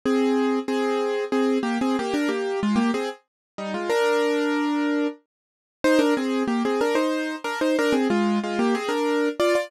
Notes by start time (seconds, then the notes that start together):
0.06 C4 G#4
0.68 C4 G#4
1.32 C4 G#4
1.63 A#3 G4
1.81 C4 G#4
1.99 A#3 G4
2.14 D4 A#4
2.28 A#3 G4
2.63 G#3 F4
2.76 A#3 G4
2.94 C4 G#4
3.58 G3 D#4
3.74 G#3 F4
3.90 D4 A#4
5.84 D#4 C5
5.99 D4 A#4
6.17 C4 G#4
6.48 A#3 G4
6.65 C4 G#4
6.81 D4 A#4
6.95 D#4 C5
7.44 D4 A#4
7.61 D#4 C5
7.79 D4 A#4
7.92 C4 G#4
8.10 G#3 F4
8.44 G#3 F4
8.59 A#3 G4
8.75 C4 G#4
8.89 D4 A#4
9.40 F4 D5
9.55 F4 D5